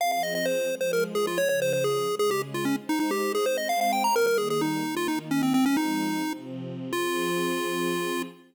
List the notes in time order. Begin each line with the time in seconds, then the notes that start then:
0.00 F3 C4 G#4 F5
0.12 F5
0.23 D#5
0.35 D#5
0.45 C5
0.69 F3 G#3 G#4
0.81 C5
0.93 A#4
1.15 G#4
1.27 F4
1.38 C#3 F3 G#4 C#5
1.49 C#5
1.62 C5
1.73 C5
1.84 G#4
2.08 C#3 G#3 G#4
2.19 G#4
2.31 G4
2.54 F4
2.65 C#4
2.77 G#3 D#4 C5
2.89 D#4
3.00 D#4
3.11 G4
3.35 G#4
3.46 G#3 C4 C5
3.57 D#5
3.69 F5
3.81 F5
3.92 G5
4.04 A#5
4.15 D#3 G3 A#3 A#4
4.27 A#4
4.38 G#4
4.50 G#4
4.61 D#4
4.85 D#3 A#3 D#4
4.97 F4
5.08 D#4
5.31 C#4
5.42 C4
5.54 F3 G#3 C4
5.66 C#4
5.77 D#4
6.23 C3 F3 C4
6.93 F3 C4 F4 G#4